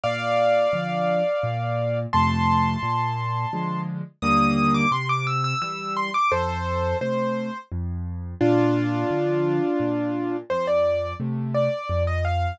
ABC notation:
X:1
M:3/4
L:1/16
Q:1/4=86
K:Bb
V:1 name="Acoustic Grand Piano"
[df]12 | [ac']12 | e'3 d' c' d' =e' e' e'2 c' d' | [Ac]4 c4 z4 |
[DF]12 | c d3 z2 d3 e f2 |]
V:2 name="Acoustic Grand Piano"
B,,4 [D,F,]4 B,,4 | [F,,C,A,]4 B,,4 [D,F,_A,]4 | [E,,D,G,B,]4 C,4 [=E,G,]4 | F,,4 [C,A,]4 F,,4 |
B,,4 [D,F,]4 B,,4 | F,,4 [C,A,]4 F,,4 |]